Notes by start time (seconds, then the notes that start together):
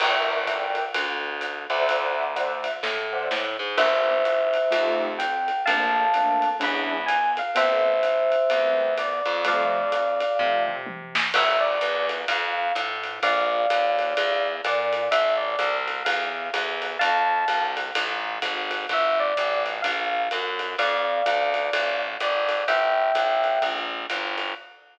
0.00 G1 A#4 D5 E5 G5, crash, ride
0.47 A#4 D5 E5 G5, kick, hi-hat pedal, ride
0.75 ride
0.94 D2, ride
1.41 hi-hat pedal, ride
1.70 D2 C5 D5 E5 F#5, ride
1.89 ride
2.36 C5 D5 E5 F#5, hi-hat pedal, ride
2.64 ride
2.83 A2, kick, snare
3.13 C5 D5 E5 F#5
3.31 A2, snare
3.59 G#2
3.77 G1 A#3 D4 E4 G4 C5 E5, crash, ride
4.25 hi-hat pedal, ride
4.54 ride
4.70 F2 A3 D#4 F4 G4, ride
5.19 G5, hi-hat pedal, ride
5.48 ride
5.65 A#1 A3 A#3 C4 D4 F5 A5, ride
6.14 A3 A#3 C4 D4, hi-hat pedal, ride
6.42 ride
6.60 E2 G#3 C#4 D4 E4 B5, kick, ride
7.06 G#5, hi-hat pedal, ride
7.37 F5, ride
7.55 A1 G3 A3 B3 C4 C5 E5, ride
8.03 hi-hat pedal, ride
8.32 ride
8.50 E2 G3 A3 B3 C4, ride
8.98 D5, hi-hat pedal, ride
9.25 F2, ride
9.45 F3 G3 A3 C4 D5 F5, ride
9.92 hi-hat pedal, ride
10.20 ride
10.39 C3 F3 G3 A3 C4, kick, floor tom
10.68 mid tom
10.87 high tom
11.15 snare
11.34 G1 E5, crash, ride
11.60 D5
11.81 E2, hi-hat pedal, ride
12.09 ride
12.28 F2 F5, kick, ride
12.75 A2, hi-hat pedal, ride
13.04 ride
13.23 A#1 D5 F5, kick, ride
13.70 D#2, hi-hat pedal, ride
13.99 ride
14.17 E2, ride
14.64 A#2 D5, hi-hat pedal, ride
14.93 ride
15.11 A1 E5, ride
15.37 D5
15.59 C2, hi-hat pedal, ride
15.88 ride
16.05 E2 F5, ride
16.54 E2, hi-hat pedal, ride
16.82 ride
16.99 F2 F5 A5, ride
17.48 C2, hi-hat pedal, ride
17.77 ride
17.95 A1, ride
18.42 G#1, kick, hi-hat pedal, ride
18.71 ride
18.89 G1 E5, kick, ride
19.20 D5
19.37 A1, kick, hi-hat pedal, ride
19.66 ride
19.82 A#1 F5, kick, ride
20.31 F#2, hi-hat pedal, ride
20.59 ride
20.78 F2 D5 F5, ride
21.26 D2, hi-hat pedal, ride
21.54 ride
21.73 A1, ride
22.20 G#1 D5, hi-hat pedal, ride
22.49 ride
22.68 G1 E5 G5, ride
23.15 A1, kick, hi-hat pedal, ride
23.44 ride
23.62 A#1, kick, ride
24.10 G1, hi-hat pedal, ride
24.38 ride